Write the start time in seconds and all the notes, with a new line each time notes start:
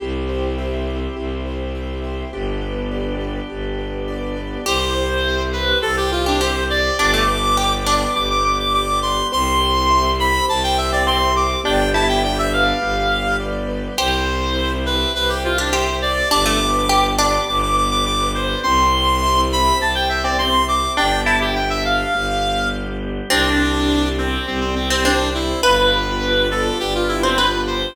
0.00 C2 C4 E4 G4
0.29 C5
0.58 E5
0.87 C5
1.16 C2 G4
1.46 C5
1.75 E5
2.04 C5
2.33 G1 B3 D4 G4
2.62 B4
2.91 D5
3.20 B4
3.50 G1 G4
3.79 B4
4.08 D5
4.37 B4
4.66 C2 C4 E4 G4 C5
4.95 C5
5.24 E5
5.53 B4 C5
5.82 C2 C4 G4 A4 C5
5.97 G4
6.11 F4 C5
6.26 D4 G4
6.41 G4 C5 E5
6.70 C5 D5
6.99 G1 B3 D4 G4 D6
7.14 A3
7.28 B4
7.57 G4 D5
7.86 D4 B4 D6
8.15 G1 G3 B3 G4 D6
8.30 D6
8.44 B4 D6
8.59 D6
8.74 D5 D6
9.02 B4 C6
9.32 C2 C4 E4 G4 C6
9.61 C5
9.90 E5
10.19 C5 B5
10.48 C2 C4 G4 C5 A5
10.63 G5
10.77 C5 E5
10.92 C4 D5
11.07 C4 E5 C6
11.36 C5 D6
11.64 G1 B3 D4 G4 G5
11.94 E4 B4 A5
12.08 G5
12.23 D5 G5
12.38 E5
12.52 B4 F5
12.81 G1 G3 B3 G4
13.11 B4
13.40 D5
13.69 B4
13.97 C2 C4 E4 G4 C5
14.27 C5
14.56 E5
14.85 B4 C5
15.14 C2 C4 G4 B4 C5
15.29 G4
15.44 F4 C5
15.58 D4 G4
15.72 G4 C5 E5
16.02 C5 D5
16.31 G1 B3 D4 G4 D6
16.46 A3
16.60 B4
16.89 G4 D5
17.18 D4 B4 D6
17.48 G1 G3 B3 G4 D6
17.62 D6
17.77 B4 D6
17.91 D6
18.06 D5 D6
18.35 B4 C5
18.63 C2 C4 E4 G4 C6
18.93 C5
19.22 E5
19.51 C5 B5
19.80 C2 C4 G4 C5 A5
19.95 G5
20.09 C5 E5
20.23 C4 D5
20.38 C4 E5 C6
20.68 C5 D6
20.96 G1 B3 D4 G4 G5
21.25 E4 A5
21.41 G4
21.55 G5
21.70 E5
21.85 F5
22.13 G1 G3 B3 G4
23.30 C2 C4 D4 G4
23.59 C5
23.88 D5
24.18 C4 C5
24.46 C2 G3 C4 G4
24.61 C4
24.75 C4 C5
24.90 C4
25.04 C4 D4 D5
25.34 E4 C5
25.63 G1 B3 D4 F4 G4 B4
25.92 G4
26.21 B4
26.50 A4 D5
26.80 G1 B3 D4 G4 B4
26.95 F4
27.08 E4 G4
27.23 C4 C5
27.38 F4 B4
27.67 G4 C5